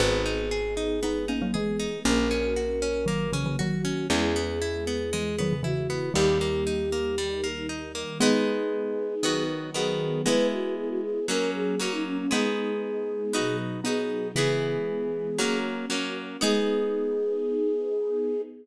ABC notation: X:1
M:4/4
L:1/16
Q:1/4=117
K:G#m
V:1 name="Flute"
G12 G4 | A12 F4 | G12 F4 | =G12 z4 |
G12 G4 | B2 F2 G F G2 A2 G2 F D C C | G12 G4 | G10 z6 |
G16 |]
V:2 name="Xylophone"
[GB]8 [B,D]2 [A,C] [F,A,] [E,G,]4 | [A,C]8 [D,F,]2 [C,E,] [C,E,] [D,F,]4 | [CE]8 [E,G,]2 [D,F,] [C,E,] [C,E,]4 | [D,=G,]8 z8 |
[G,B,]12 z4 | [G,B,]12 z4 | [G,B,]12 [B,D]4 | [C,E,]4 z12 |
G,16 |]
V:3 name="Orchestral Harp"
B,2 D2 G2 D2 B,2 D2 G2 D2 | A,2 C2 F2 C2 A,2 C2 F2 C2 | G,2 B,2 E2 B,2 G,2 B,2 E2 B,2 | =G,2 A,2 D2 A,2 G,2 A,2 D2 A,2 |
[G,B,D]8 [D,B,F]4 [D,B,F]4 | [G,B,E]8 [F,A,C]4 [F,A,C]4 | [G,B,D]8 [B,DF]4 [B,DF]4 | [E,B,G]8 [F,A,C]4 [F,A,C]4 |
[B,DG]16 |]
V:4 name="Electric Bass (finger)" clef=bass
G,,,16 | A,,,16 | E,,16 | D,,16 |
z16 | z16 | z16 | z16 |
z16 |]
V:5 name="String Ensemble 1"
[B,DG]8 [G,B,G]8 | [A,CF]8 [F,A,F]8 | [G,B,E]8 [E,G,E]8 | [=G,A,D]8 [D,G,D]8 |
[G,B,D]8 [D,F,B,]8 | [G,B,E]8 [F,A,C]8 | [G,B,D]8 [B,,F,D]8 | [E,G,B,]8 [F,A,C]8 |
[B,DG]16 |]